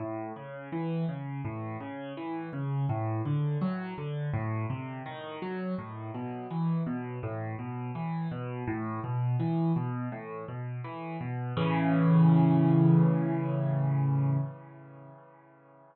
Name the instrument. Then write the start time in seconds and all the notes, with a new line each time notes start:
acoustic grand piano
0.00 A2
0.36 C#3
0.72 E3
1.09 C#3
1.45 A2
1.80 C#3
2.17 E3
2.53 C#3
2.89 A2
3.25 D3
3.61 F#3
3.98 D3
4.34 A2
4.70 C3
5.06 D#3
5.42 F#3
5.78 A2
6.14 B2
6.51 E3
6.86 B2
7.23 A2
7.59 B2
7.95 E3
8.31 B2
8.67 A2
9.04 B2
9.40 E3
9.76 B2
10.12 A2
10.48 B2
10.84 E3
11.21 B2
11.57 A2 C#3 E3